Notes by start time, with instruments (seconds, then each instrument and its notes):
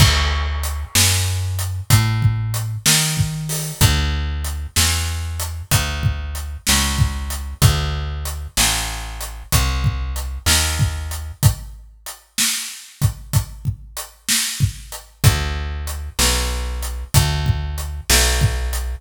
0.00 electric bass (finger) D2, kick, crash
0.63 closed hi-hat
0.95 electric bass (finger) F#2, snare
1.59 closed hi-hat
1.90 electric bass (finger) A2, kick, closed hi-hat
2.22 kick
2.54 closed hi-hat
2.86 electric bass (finger) D#3, snare
3.17 kick
3.49 open hi-hat
3.81 electric bass (finger) D2, kick, closed hi-hat
4.44 closed hi-hat
4.76 electric bass (finger) E2, snare
5.40 closed hi-hat
5.71 electric bass (finger) D2, kick, closed hi-hat
6.03 kick
6.35 closed hi-hat
6.67 electric bass (finger) C#2, snare
6.98 kick
7.30 closed hi-hat
7.62 electric bass (finger) D2, kick, closed hi-hat
8.25 closed hi-hat
8.57 electric bass (finger) A1, snare
9.21 closed hi-hat
9.52 electric bass (finger) C2, kick, closed hi-hat
9.84 kick
10.16 closed hi-hat
10.46 electric bass (finger) D#2, snare
10.79 kick
11.11 closed hi-hat
11.43 kick, closed hi-hat
12.06 closed hi-hat
12.38 snare
13.02 kick, closed hi-hat
13.33 kick, closed hi-hat
13.65 kick
13.97 closed hi-hat
14.29 snare
14.60 kick
14.92 closed hi-hat
15.24 electric bass (finger) D2, kick, closed hi-hat
15.87 closed hi-hat
16.19 electric bass (finger) B1, snare
16.83 closed hi-hat
17.14 electric bass (finger) D2, kick, closed hi-hat
17.46 kick
17.78 closed hi-hat
18.10 electric bass (finger) B1, snare
18.41 kick
18.73 closed hi-hat